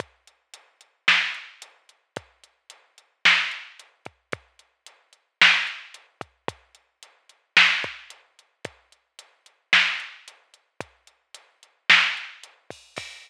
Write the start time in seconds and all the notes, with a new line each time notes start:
0.00 kick, closed hi-hat
0.27 closed hi-hat
0.54 closed hi-hat
0.81 closed hi-hat
1.08 snare
1.34 closed hi-hat
1.62 closed hi-hat
1.89 closed hi-hat
2.16 kick, closed hi-hat
2.44 closed hi-hat
2.70 closed hi-hat
2.98 closed hi-hat
3.25 snare
3.51 closed hi-hat
3.80 closed hi-hat
4.05 kick, closed hi-hat
4.32 kick, closed hi-hat
4.59 closed hi-hat
4.86 closed hi-hat
5.13 closed hi-hat
5.41 snare
5.67 closed hi-hat
5.94 closed hi-hat
6.21 kick, closed hi-hat
6.48 kick, closed hi-hat
6.75 closed hi-hat
7.03 closed hi-hat
7.29 closed hi-hat
7.57 snare
7.84 kick, closed hi-hat
8.10 closed hi-hat
8.39 closed hi-hat
8.65 kick, closed hi-hat
8.92 closed hi-hat
9.19 closed hi-hat
9.46 closed hi-hat
9.73 snare
10.00 closed hi-hat
10.28 closed hi-hat
10.54 closed hi-hat
10.81 kick, closed hi-hat
11.07 closed hi-hat
11.34 closed hi-hat
11.63 closed hi-hat
11.90 snare
12.17 closed hi-hat
12.43 closed hi-hat
12.70 kick, open hi-hat
12.97 kick, crash